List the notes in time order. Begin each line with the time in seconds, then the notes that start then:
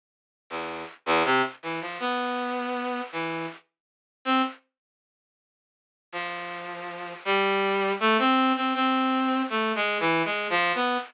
0.50 E2
1.06 E2
1.25 C3
1.63 E3
1.81 F3
2.00 B3
3.12 E3
4.25 C4
6.12 F3
7.25 G3
8.00 A3
8.19 C4
8.56 C4
8.75 C4
9.50 A3
9.75 G#3
10.00 E3
10.25 G#3
10.50 F3
10.75 B3